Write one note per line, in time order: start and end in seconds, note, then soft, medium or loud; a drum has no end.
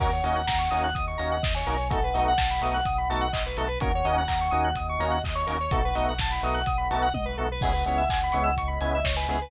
0.00 0.20 D#2 loud
0.00 0.08 A#3 loud
0.00 0.08 C#4 loud
0.00 0.08 D#4 loud
0.00 0.08 F#4 loud
0.00 0.11 A#4 loud
0.00 0.79 F#5 medium
0.00 kick loud
0.00 crash loud
0.12 0.23 C#5 medium
0.24 0.45 D#2 medium
0.24 0.40 A#3 medium
0.24 0.40 C#4 medium
0.24 0.40 D#4 medium
0.24 0.40 F#4 medium
0.24 0.36 D#5 medium
0.24 open hi-hat medium
0.35 0.46 F#5 medium
0.47 0.68 D#2 medium
0.47 0.58 A#5 medium
0.47 kick medium
0.47 snare loud
0.58 0.69 C#6 medium
0.70 0.93 D#2 medium
0.70 0.88 A#3 medium
0.70 0.88 C#4 medium
0.70 0.88 D#4 loud
0.70 0.88 F#4 medium
0.70 0.81 D#6 medium
0.70 open hi-hat medium
0.83 0.94 F#6 medium
0.94 1.15 D#2 medium
0.94 1.35 D#5 medium
0.94 1.05 D#6 medium
0.94 kick medium
0.94 closed hi-hat loud
1.07 1.18 C#6 medium
1.17 1.40 D#2 medium
1.17 1.36 A#3 medium
1.17 1.36 C#4 medium
1.17 1.36 D#4 medium
1.17 1.36 F#4 medium
1.17 1.28 A#5 medium
1.17 open hi-hat medium
1.31 1.42 F#5 medium
1.42 1.63 D#2 medium
1.42 1.53 D#5 medium
1.42 kick loud
1.42 snare loud
1.55 1.66 C#5 medium
1.55 1.89 G#5 medium
1.66 2.11 B1 loud
1.66 1.75 A#3 medium
1.66 1.75 C#4 medium
1.66 1.75 D#4 medium
1.66 1.75 F#4 medium
1.66 1.77 A#4 medium
1.66 open hi-hat medium
1.77 1.87 C#5 medium
1.90 1.99 A3 loud
1.90 1.99 B3 loud
1.90 1.99 D#4 loud
1.90 1.99 F#4 medium
1.90 2.03 A4 medium
1.90 2.35 F#5 medium
1.90 kick loud
1.90 closed hi-hat loud
2.03 2.14 B4 medium
2.14 2.35 B1 medium
2.14 2.31 A3 medium
2.14 2.31 B3 medium
2.14 2.31 D#4 loud
2.14 2.31 F#4 medium
2.14 2.24 D#5 medium
2.14 open hi-hat loud
2.27 2.38 F#5 medium
2.38 2.59 B1 medium
2.38 3.20 F#5 medium
2.38 2.49 A5 medium
2.38 kick medium
2.38 snare loud
2.50 2.61 B5 medium
2.61 2.81 B1 medium
2.61 2.78 A3 medium
2.61 2.78 B3 medium
2.61 2.78 D#4 medium
2.61 2.78 F#4 medium
2.61 2.74 D#6 medium
2.61 open hi-hat medium
2.74 2.84 F#6 medium
2.85 3.06 B1 medium
2.85 2.96 D#6 medium
2.85 kick loud
2.85 closed hi-hat loud
2.98 3.08 B5 medium
3.09 3.29 B1 medium
3.09 3.26 A3 medium
3.09 3.26 B3 loud
3.09 3.26 D#4 medium
3.09 3.26 F#4 loud
3.09 3.20 A5 medium
3.09 open hi-hat medium
3.21 3.31 F#5 medium
3.32 3.54 B1 medium
3.32 3.43 D#5 medium
3.32 kick medium
3.32 clap loud
3.46 3.57 B4 medium
3.57 3.77 B1 medium
3.57 3.66 A3 medium
3.57 3.66 B3 medium
3.57 3.66 D#4 medium
3.57 3.66 F#4 medium
3.57 3.68 A4 medium
3.57 open hi-hat medium
3.68 3.78 B4 medium
3.80 4.02 D#2 medium
3.80 3.89 A#3 medium
3.80 3.89 C#4 loud
3.80 3.89 D#4 loud
3.80 3.89 F#4 loud
3.80 3.92 A#4 loud
3.80 4.69 F#5 medium
3.80 kick loud
3.80 closed hi-hat loud
3.95 4.05 C#5 medium
4.04 4.25 D#2 medium
4.04 4.21 A#3 medium
4.04 4.21 C#4 loud
4.04 4.21 D#4 medium
4.04 4.21 F#4 medium
4.04 4.16 D#5 medium
4.04 open hi-hat medium
4.17 4.28 F#5 medium
4.27 4.49 D#2 medium
4.27 4.38 A#5 medium
4.27 kick medium
4.27 clap loud
4.41 4.51 C#6 medium
4.51 4.73 D#2 medium
4.51 4.69 A#3 medium
4.51 4.69 C#4 loud
4.51 4.69 D#4 loud
4.51 4.69 F#4 medium
4.51 4.61 D#6 medium
4.51 open hi-hat medium
4.64 4.75 F#6 medium
4.75 4.97 D#2 medium
4.75 5.16 D#5 medium
4.75 4.87 D#6 medium
4.75 kick medium
4.75 closed hi-hat loud
4.89 5.00 C#6 medium
4.99 5.19 D#2 medium
4.99 5.17 A#3 medium
4.99 5.17 C#4 medium
4.99 5.17 D#4 medium
4.99 5.17 F#4 medium
4.99 5.10 A#5 medium
4.99 open hi-hat medium
5.11 5.22 F#5 medium
5.24 5.44 D#2 medium
5.24 5.35 D#5 medium
5.24 kick medium
5.24 clap loud
5.35 5.46 C#5 medium
5.35 5.69 C#6 medium
5.47 5.68 D#2 medium
5.47 5.56 A#3 medium
5.47 5.56 C#4 medium
5.47 5.56 D#4 medium
5.47 5.56 F#4 medium
5.47 5.57 A#4 medium
5.47 open hi-hat loud
5.60 5.71 C#5 medium
5.71 5.92 B1 loud
5.71 5.80 A3 loud
5.71 5.80 B3 loud
5.71 5.80 D#4 medium
5.71 5.80 F#4 loud
5.71 5.83 A4 medium
5.71 6.11 F#5 medium
5.71 kick loud
5.71 closed hi-hat loud
5.84 5.95 B4 medium
5.95 6.16 B1 medium
5.95 6.12 A3 medium
5.95 6.12 B3 medium
5.95 6.12 D#4 medium
5.95 6.12 F#4 medium
5.95 6.06 D#5 medium
5.95 open hi-hat loud
6.08 6.19 F#5 medium
6.18 6.38 B1 medium
6.18 7.06 F#5 medium
6.18 6.31 A5 medium
6.18 kick loud
6.18 snare loud
6.31 6.41 B5 medium
6.43 6.63 B1 medium
6.43 6.60 A3 medium
6.43 6.60 B3 medium
6.43 6.60 D#4 medium
6.43 6.60 F#4 medium
6.43 6.54 D#6 medium
6.43 open hi-hat medium
6.54 6.65 F#6 medium
6.66 6.87 B1 medium
6.66 6.77 D#6 medium
6.66 kick loud
6.66 closed hi-hat loud
6.78 6.88 B5 medium
6.91 7.11 B1 medium
6.91 7.07 A3 medium
6.91 7.07 B3 medium
6.91 7.07 D#4 medium
6.91 7.07 F#4 medium
6.91 7.02 A5 medium
6.91 open hi-hat medium
7.02 7.13 F#5 medium
7.14 7.34 B1 medium
7.14 7.25 D#5 medium
7.14 kick medium
7.14 high tom medium
7.25 7.36 B4 medium
7.37 7.58 B1 medium
7.37 7.47 A3 medium
7.37 7.47 B3 medium
7.37 7.47 D#4 medium
7.37 7.47 F#4 medium
7.37 7.48 A4 medium
7.51 7.62 B4 medium
7.61 7.83 C#2 loud
7.61 7.70 G#3 loud
7.61 7.70 B3 loud
7.61 7.70 C#4 loud
7.61 7.70 E4 loud
7.61 7.73 G#4 medium
7.61 8.52 F#5 medium
7.61 kick loud
7.61 crash loud
7.73 7.84 B4 medium
7.85 8.06 C#2 medium
7.85 8.02 G#3 medium
7.85 8.02 B3 medium
7.85 8.02 C#4 medium
7.85 8.02 E4 medium
7.85 7.97 C#5 medium
7.85 open hi-hat medium
7.97 8.08 E5 medium
8.09 8.29 C#2 medium
8.09 8.20 G#5 medium
8.09 kick loud
8.09 clap loud
8.23 8.34 B5 medium
8.32 8.54 C#2 medium
8.32 8.50 G#3 loud
8.32 8.50 B3 medium
8.32 8.50 C#4 medium
8.32 8.50 E4 medium
8.32 8.43 C#6 medium
8.32 open hi-hat medium
8.43 8.54 E6 medium
8.57 8.77 C#2 loud
8.57 8.98 D#5 medium
8.57 8.68 C#6 medium
8.57 kick medium
8.57 closed hi-hat loud
8.68 8.78 B5 medium
8.81 9.02 C#2 medium
8.81 8.98 G#3 medium
8.81 8.98 B3 medium
8.81 8.98 C#4 medium
8.81 8.98 E4 medium
8.81 8.91 G#5 medium
8.81 open hi-hat medium
8.94 9.05 E5 medium
9.04 9.26 C#2 medium
9.04 9.15 C#5 medium
9.04 kick medium
9.04 snare loud
9.16 9.27 B4 medium
9.16 9.50 G#5 medium
9.28 9.48 C#2 medium
9.28 9.37 G#3 medium
9.28 9.37 B3 medium
9.28 9.37 C#4 medium
9.28 9.37 E4 medium
9.28 9.40 G#4 medium
9.28 open hi-hat medium
9.41 9.50 B4 medium